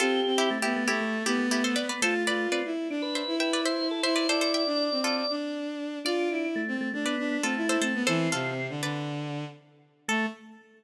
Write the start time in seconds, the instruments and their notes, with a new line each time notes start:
0.00 violin C4, pizzicato strings F4 A4, drawbar organ G4
0.26 violin C4
0.38 pizzicato strings E4 G4
0.50 drawbar organ A3
0.62 violin B3, pizzicato strings E4 G4
0.76 drawbar organ A3
0.88 violin A3, drawbar organ A3, pizzicato strings E4 G4
1.01 drawbar organ A3
1.26 violin B3, pizzicato strings E4 G4
1.39 drawbar organ A3
1.51 pizzicato strings E4 G4
1.64 pizzicato strings A4 C5
1.76 drawbar organ B3, pizzicato strings B4 D5
1.89 pizzicato strings B4 D5
2.02 drawbar organ A3, violin F4, pizzicato strings A4 C5
2.27 violin F4, pizzicato strings B4 D5
2.52 drawbar organ C4, pizzicato strings B4 D5
2.65 violin E4
2.90 violin D4, drawbar organ D4
3.02 drawbar organ B4
3.15 pizzicato strings C5 E5
3.27 violin E4
3.40 drawbar organ B4, pizzicato strings E5 G5
3.53 pizzicato strings B4 D5
3.65 drawbar organ C5, pizzicato strings C5 E5
3.91 drawbar organ A4
4.03 violin E4, drawbar organ C5, pizzicato strings C5 E5
4.16 pizzicato strings B4 D5, drawbar organ C5
4.29 violin E4, pizzicato strings A4 C5, drawbar organ D5
4.41 pizzicato strings A4 C5
4.54 pizzicato strings E5 G5
4.66 violin D4
4.92 violin C4
5.04 pizzicato strings F4 A4
5.30 violin D4
6.05 drawbar organ D4, violin F4, pizzicato strings D5 F5
6.30 violin E4
6.56 drawbar organ A3
6.68 violin C4
6.81 drawbar organ A3
6.93 drawbar organ A3, violin D4
7.05 drawbar organ B3, pizzicato strings B4 D5
7.18 violin D4
7.43 drawbar organ A3, violin C4, pizzicato strings F4 A4
7.57 violin E4
7.69 violin E4, pizzicato strings A4 C5
7.81 drawbar organ A3, violin C4, pizzicato strings A4 C5
7.94 violin B3
8.07 violin E3, drawbar organ C4, pizzicato strings A4 C5
8.32 violin C3, pizzicato strings F4 A4
8.69 violin D3
8.82 violin D3, pizzicato strings B4 D5
10.08 drawbar organ A3, violin A3, pizzicato strings A4